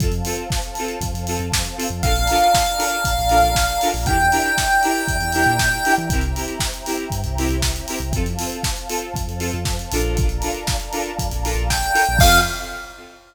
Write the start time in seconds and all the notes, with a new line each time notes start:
0.00 F2 C4 F4 A4 C5 F5 A5, kick, closed hi-hat
0.12 closed hi-hat
0.25 C4 F4 A4, open hi-hat
0.38 closed hi-hat
0.50 kick, snare
0.62 closed hi-hat
0.75 C4 F4 A4, open hi-hat
0.88 closed hi-hat
1.01 F2, kick, closed hi-hat
1.14 F2, closed hi-hat
1.27 C4 F4 A4, open hi-hat
1.39 F2, closed hi-hat
1.52 kick, snare
1.65 closed hi-hat
1.77 C4 F4 A4, open hi-hat
1.90 F2, closed hi-hat
2.03 A#1 D4 F4 A4 A#4 D5 F5 A5 A#5, kick, closed hi-hat
2.16 closed hi-hat
2.27 D4 F4 A4 A#4, open hi-hat
2.42 closed hi-hat
2.54 kick, snare
2.66 closed hi-hat
2.78 D4 F4 A4 A#4, open hi-hat
2.92 closed hi-hat
3.05 A#1, kick, closed hi-hat
3.19 A#1, closed hi-hat
3.29 D4 F4 A4 A#4, open hi-hat
3.43 A#1, closed hi-hat
3.55 kick, snare
3.69 closed hi-hat
3.81 D4 F4 A4 A#4, open hi-hat
3.94 A#1, open hi-hat
4.06 E2 D4 E4 G4 A#4 D5 E5 G5 A#5, kick, closed hi-hat
4.20 closed hi-hat
4.32 D4 E4 G4 A#4, open hi-hat
4.44 closed hi-hat
4.58 kick, snare
4.71 closed hi-hat
4.83 D4 E4 G4 A#4, open hi-hat
5.08 E2, kick, closed hi-hat
5.21 E2, closed hi-hat
5.32 D4 E4 G4 A#4, open hi-hat
5.46 A#2, closed hi-hat
5.59 kick, snare
5.72 closed hi-hat
5.85 D4 E4 G4 A#4, open hi-hat
5.98 E3, closed hi-hat
6.10 C2 C4 E4 G4 A#4 C5 E5 G5 A#5, kick, closed hi-hat
6.21 closed hi-hat
6.35 C4 E4 G4 A#4, open hi-hat
6.48 closed hi-hat
6.60 kick, snare
6.74 closed hi-hat
6.86 C4 E4 G4 A#4, open hi-hat
6.98 closed hi-hat
7.10 G2, kick, closed hi-hat
7.24 C2, closed hi-hat
7.38 C4 E4 G4 A#4, open hi-hat
7.49 C2, closed hi-hat
7.62 kick, snare
7.76 closed hi-hat
7.88 C4 E4 G4 A#4, open hi-hat
8.00 C2, closed hi-hat
8.12 F2 C4 F4 A4 C5 F5 A5, kick, closed hi-hat
8.26 closed hi-hat
8.39 C4 F4 A4, open hi-hat
8.52 closed hi-hat
8.63 kick, snare
8.77 closed hi-hat
8.89 C4 F4 A4, open hi-hat
9.01 closed hi-hat
9.14 F2, kick, closed hi-hat
9.27 F2, closed hi-hat
9.39 C4 F4 A4, open hi-hat
9.53 F2, closed hi-hat
9.65 kick, snare
9.79 closed hi-hat
9.92 A#1 D4 F4 A4 A#4, open hi-hat
10.03 closed hi-hat
10.17 D5 F5 A5 A#5, kick, closed hi-hat
10.29 closed hi-hat
10.42 D4 F4 A4 A#4, open hi-hat
10.55 closed hi-hat
10.67 kick, snare
10.80 closed hi-hat
10.92 D4 F4 A4 A#4, open hi-hat
11.06 closed hi-hat
11.19 F2, kick, closed hi-hat
11.31 A#1, closed hi-hat
11.44 D4 F4 A4 A#4, open hi-hat
11.55 A#1, closed hi-hat
11.70 G5, kick, snare
11.83 closed hi-hat
11.94 D4 F4 A4 A#4, open hi-hat
12.07 A#1, closed hi-hat
12.19 F2 C4 F4 A4 F5, kick, crash